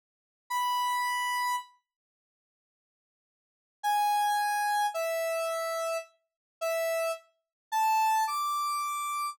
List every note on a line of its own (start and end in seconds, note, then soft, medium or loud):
0.50 1.56 B5 medium
3.83 4.86 G#5 medium
4.94 5.97 E5 medium
6.61 7.11 E5 medium
7.72 8.24 A5 medium
8.27 9.30 D6 soft